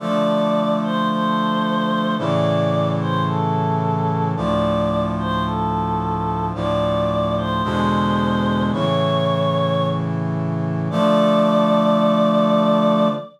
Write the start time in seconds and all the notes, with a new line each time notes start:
0.00 D3 F3 A3 D5
0.83 C5
1.09 C5
2.18 A2 C#3 E3 D5
3.00 C5
3.27 A4
4.36 D2 A2 F3 D5
5.19 C5
5.46 A4
6.55 D2 A2 F3 D5
7.37 C5
7.64 E2 B2 D3 G#3 C5
8.72 A2 C#3 E3 C#5
10.90 D3 F3 A3 D5